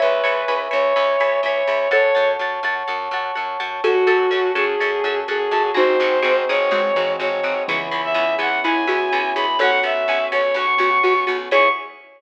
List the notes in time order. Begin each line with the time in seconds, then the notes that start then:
0.00 C#2 B4 C#5 E5 G#5 B5
0.24 C#2 C#5 E5 G#5 B5
0.48 C#2 C#5 E5 G#5 B5
0.71 C#2 C#5 E5 G#5 B5
0.96 C#2 C#5 E5 G#5 B5
1.20 C#2 C#5 E5 G#5 B5
1.43 C#2 C#5 E5 G#5 B5
1.67 C#2 C#5 E5 G#5 B5
1.91 F#2 A4 C#5 F#5 A5
2.15 F#2 C#5 F#5 A5
2.39 F#2 C#5 F#5 A5
2.63 F#2 C#5 F#5 A5
2.88 F#2 C#5 F#5 A5
3.11 F#2 C#5 F#5 A5
3.35 F#2 C#5 F#5 A5
3.60 F#2 C#5 F#5 A5
3.83 F#2 C#4 F#4 A4
4.07 F#2 C#4 F#4 A4
4.31 F#2 C#4 F#4 A4
4.55 F#2 C#4 F#4 G#4 A4
4.80 F#2 C#4 F#4 A4
5.04 F#2 C#4 F#4 A4
5.28 F#2 C#4 F#4 G#4 A4
5.51 F#2 C#4 F#4 A4
5.74 G#1 C4 D#4 F#4 G#4 C5
6.00 G#1 C4 D#4 F#4 G#4
6.22 G#1 C4 D#4 F#4 G#4
6.49 G#1 C4 D#4 F#4 G#4 C#5
6.71 G#1 G#3 C4 D#4 F#4 G#4
6.95 G#1 E3 C4 D#4 F#4 G#4
7.20 G#1 C4 D#4 F#4 G#4 C#5
7.43 G#1 C4 D#4 F#4 G#4
7.67 C#2 C#3 E3 B3 C#4 E4 G#4
7.91 C#2 B3 C#4 E4 G#4
8.05 E5
8.14 C#2 B3 C#4 E4 G#4
8.38 C#2 B3 C#4 E4 G#4 F#5
8.64 C#2 B3 C#4 E4 G#4 G#5
8.87 C#2 B3 C#4 E4 F#4 G#4
9.12 C#2 B3 C#4 E4 G#4
9.35 C#2 B3 C#4 E4 G#4 B5
9.59 B1 B3 C#4 F#4 A4 C#5 F#5
9.83 B1 B3 C#4 F#4 E5
10.08 B1 B3 C#4 F#4
10.32 B1 B3 C#4 F#4 C#5
10.54 B1 B3 C#4 F#4 C#6
10.78 B1 B3 C#4 F#4
11.03 B1 B3 C#4 F#4
11.27 B1 B3 C#4 F#4
11.51 C#2 B3 C#4 E4 G#4 B4 C#5 C#6